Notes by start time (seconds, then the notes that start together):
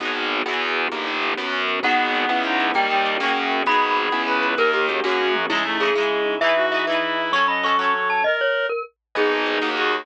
0.00 G#1 B3 D#4 F#4 G#4, kick, closed hi-hat
0.05 F#4 G#4
0.23 closed hi-hat
0.46 E2 B3 E4 F#4 G#4, cross-stick
0.51 F#4 G#4
0.68 closed hi-hat
0.92 G1 A#3 D#4 G4, kick, closed hi-hat
1.07 D#4
1.14 closed hi-hat
1.22 G4
1.37 F#2 B3 C#4 F#4, snare
1.53 C#4
1.60 closed hi-hat
1.68 F#4
1.83 G#1 B3 D#4 F#4 G#4 F#5, kick, closed hi-hat
1.88 F#4 G#4
1.99 closed hi-hat
2.15 closed hi-hat
2.29 C#2 B3 C#4 E4 G#4, cross-stick
2.43 C#4 D#4, closed hi-hat
2.60 E4, closed hi-hat
2.74 D#2 G3 A#3 D#4 G4 G5, kick, closed hi-hat
2.90 G3 D#4, closed hi-hat
3.05 G4, closed hi-hat
3.20 F#2 A#3 C#4 F#4 G#4, snare
3.26 F#4 G#4
3.37 closed hi-hat
3.51 closed hi-hat
3.66 G#1 B3 D#4 F#4 G#4 B5, kick, closed hi-hat
3.71 F#4 G#4
3.82 closed hi-hat
3.97 closed hi-hat
4.12 C#2 B3 C#4 E4 G#4, cross-stick
4.27 C#4 B4
4.42 E4, closed hi-hat
4.57 D#2 A#3 D#4 G4 A#4, kick, closed hi-hat
4.73 D#4 G4, closed hi-hat
4.89 A#3 C#4 F#4 G4 G#4, closed hi-hat
5.03 F#2 A#3 C#4 F#4 G#4, kick, snare
5.09 F#4 G#4
5.19 high tom
5.35 mid tom
5.49 C#3 G#3 D#4 E4 G#4, kick, crash
5.55 E4 G#4
5.64 A3 D#4
5.80 C#3 D#4 E4 G#4
5.85 E4 G#4
5.94 C#3 G#3 D#4 G#4
6.00 E4 G#4
6.10 C#3
6.26 D#4
6.41 E3 D#4 E4 G#4 B4 E5, kick
6.46 G#4 B4
6.56 D#4 F#4
6.72 E3 D#4 G#4 E5
6.77 G#4 B4
6.87 E3 D#4 E4 B4
6.92 G#4 B4
7.03 E3
7.17 D#4
7.31 F#3 C#4 A4 C#5 C#6, kick
7.35 C#4 A4
7.48 C#4 D#5 B5
7.63 F#3 C#4 A4 C#6
7.68 A4
7.78 F#3 C#4 C#5
7.84 A4
7.94 C#4
8.10 A4 A5
8.24 A#4 D#5, kick
8.41 C#5
8.69 A#4
9.15 G#1 B3 D#4 G#4 B4 D#5 G#5, kick, closed hi-hat
9.31 D#4
9.46 G#4, closed hi-hat
9.61 D#2 A#3 D#4 F#4 A#4 D#5 F#5, snare
9.76 D#4 F#4, closed hi-hat
9.92 F#4, closed hi-hat